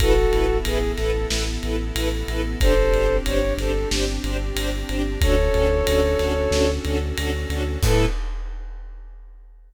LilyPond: <<
  \new Staff \with { instrumentName = "Violin" } { \time 4/4 \key a \major \tempo 4 = 92 <fis' a'>4 gis'8 a'8 r2 | <a' c''>4 cis''8 a'8 r2 | <a' cis''>2~ <a' cis''>8 r4. | a'4 r2. | }
  \new Staff \with { instrumentName = "String Ensemble 1" } { \time 4/4 \key a \major <e' a' b'>8 <e' a' b'>8 <e' a' b'>8 <e' a' b'>8 <e' a' b'>8 <e' a' b'>8 <e' a' b'>8 <e' a' b'>8 | <d' g' c''>8 <d' g' c''>8 <d' g' c''>8 <d' g' c''>8 <d' g' c''>8 <d' g' c''>8 <d' g' c''>8 <d' g' c''>8 | <cis' d' fis' a'>8 <cis' d' fis' a'>8 <cis' d' fis' a'>8 <cis' d' fis' a'>8 <cis' d' fis' a'>8 <cis' d' fis' a'>8 <cis' d' fis' a'>8 <cis' d' fis' a'>8 | <e' a' b'>4 r2. | }
  \new Staff \with { instrumentName = "Synth Bass 2" } { \clef bass \time 4/4 \key a \major a,,8 a,,8 a,,8 a,,8 a,,8 a,,8 a,,8 a,,8 | g,,8 g,,8 g,,8 g,,8 g,,8 g,,8 g,,8 g,,8 | d,8 d,8 d,8 d,8 d,8 d,8 d,8 d,8 | a,4 r2. | }
  \new Staff \with { instrumentName = "String Ensemble 1" } { \time 4/4 \key a \major <b e' a'>1 | <c' d' g'>1 | <cis' d' fis' a'>1 | <b e' a'>4 r2. | }
  \new DrumStaff \with { instrumentName = "Drums" } \drummode { \time 4/4 <bd cymr>8 cymr8 cymr8 <cymr sn>8 sn8 cymr8 cymr8 cymr8 | <bd cymr>8 cymr8 cymr8 <cymr sn>8 sn8 cymr8 cymr8 cymr8 | <bd cymr>8 cymr8 cymr8 <cymr sn>8 sn8 cymr8 cymr8 cymr8 | <cymc bd>4 r4 r4 r4 | }
>>